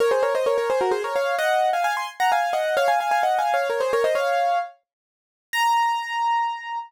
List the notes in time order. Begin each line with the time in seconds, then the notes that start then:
0.00 A#4 C#5
0.11 G#4 C5
0.23 A#4 C#5
0.35 C5 D#5
0.46 A#4 C#5
0.58 A#4 C#5
0.70 G#4 C5
0.81 F#4 A#4
0.91 G#4 C5
1.04 A#4 C#5
1.16 C#5 F5
1.39 D#5 F#5
1.73 F5 G#5
1.84 F5 G#5
1.97 G#5 C6
2.20 F#5 A#5
2.32 F5 G#5
2.53 D#5 F#5
2.77 C#5 F5
2.88 F5 G#5
3.00 F5 G#5
3.11 F5 G#5
3.23 D#5 F#5
3.39 F5 G#5
3.54 C#5 F5
3.70 A#4 C#5
3.80 G#4 C5
3.93 A#4 C#5
4.04 C5 D#5
4.15 C#5 F5
5.53 A#5